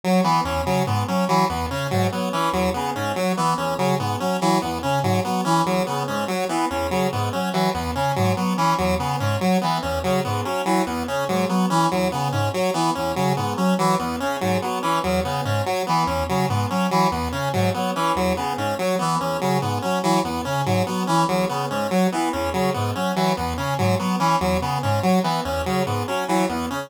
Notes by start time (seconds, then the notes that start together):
0.04 F#3
0.24 E3 B3
0.44 E2 C#4
0.65 C#3 F#3
0.87 G#2 B3
1.08 F#3 C#4
1.28 E3 F#3
1.49 E2 B3
1.71 C#3 C#4
1.91 G#2 F#3
2.12 F#3 B3
2.32 E3 C#4
2.53 E2 F#3
2.74 C#3 B3
2.95 G#2 C#4
3.16 F#3
3.37 E3 B3
3.58 E2 C#4
3.78 C#3 F#3
3.99 G#2 B3
4.20 F#3 C#4
4.41 E3 F#3
4.62 E2 B3
4.83 C#3 C#4
5.03 G#2 F#3
5.24 F#3 B3
5.45 E3 C#4
5.65 E2 F#3
5.86 C#3 B3
6.08 G#2 C#4
6.28 F#3
6.49 E3 B3
6.70 E2 C#4
6.91 C#3 F#3
7.12 G#2 B3
7.33 F#3 C#4
7.53 E3 F#3
7.74 E2 B3
7.95 C#3 C#4
8.16 G#2 F#3
8.37 F#3 B3
8.57 E3 C#4
8.78 E2 F#3
8.99 C#3 B3
9.20 G#2 C#4
9.41 F#3
9.61 E3 B3
9.82 E2 C#4
10.04 C#3 F#3
10.24 G#2 B3
10.45 F#3 C#4
10.65 E3 F#3
10.86 E2 B3
11.07 C#3 C#4
11.28 G#2 F#3
11.49 F#3 B3
11.70 E3 C#4
11.91 E2 F#3
12.12 C#3 B3
12.32 G#2 C#4
12.53 F#3
12.74 E3 B3
12.95 E2 C#4
13.16 C#3 F#3
13.37 G#2 B3
13.57 F#3 C#4
13.78 E3 F#3
13.99 E2 B3
14.20 C#3 C#4
14.41 G#2 F#3
14.62 F#3 B3
14.82 E3 C#4
15.04 E2 F#3
15.24 C#3 B3
15.45 G#2 C#4
15.65 F#3
15.87 E3 B3
16.07 E2 C#4
16.29 C#3 F#3
16.49 G#2 B3
16.70 F#3 C#4
16.91 E3 F#3
17.11 E2 B3
17.32 C#3 C#4
17.53 G#2 F#3
17.74 F#3 B3
17.95 E3 C#4
18.15 E2 F#3
18.37 C#3 B3
18.57 G#2 C#4
18.79 F#3
18.99 E3 B3
19.20 E2 C#4
19.41 C#3 F#3
19.62 G#2 B3
19.82 F#3 C#4
20.03 E3 F#3
20.24 E2 B3
20.45 C#3 C#4
20.65 G#2 F#3
20.86 F#3 B3
21.07 E3 C#4
21.28 E2 F#3
21.49 C#3 B3
21.70 G#2 C#4
21.91 F#3
22.12 E3 B3
22.33 E2 C#4
22.53 C#3 F#3
22.74 G#2 B3
22.95 F#3 C#4
23.16 E3 F#3
23.37 E2 B3
23.57 C#3 C#4
23.78 G#2 F#3
23.99 F#3 B3
24.19 E3 C#4
24.41 E2 F#3
24.61 C#3 B3
24.83 G#2 C#4
25.03 F#3
25.23 E3 B3
25.45 E2 C#4
25.66 C#3 F#3
25.86 G#2 B3
26.07 F#3 C#4
26.28 E3 F#3
26.49 E2 B3
26.70 C#3 C#4